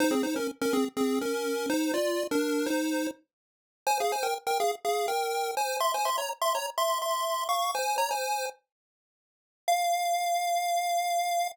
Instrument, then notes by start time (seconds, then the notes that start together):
lead 1 (square)
0.00 D#4 C5
0.11 C4 G#4
0.23 D#4 C5
0.36 C#4 A#4
0.61 C#4 A#4
0.73 C4 G#4
0.97 C4 G#4
1.21 C#4 A#4
1.69 D#4 C5
1.94 F4 D5
2.31 D4 A#4
2.66 D#4 C5
3.86 C5 G#5
4.00 G#4 F5
4.12 C5 G#5
4.23 A#4 G5
4.47 A#4 G5
4.60 G#4 F5
4.84 G#4 F5
5.08 A#4 G5
5.57 C5 G#5
5.80 E5 C6
5.94 C5 G#5
6.05 E5 C6
6.18 C#5 A#5
6.41 E5 C6
6.55 C#5 A#5
6.78 E5 C6
7.02 E5 C6
7.49 F5 C#6
7.75 C5 G#5
7.98 C#5 A#5
8.11 C5 G#5
9.68 F5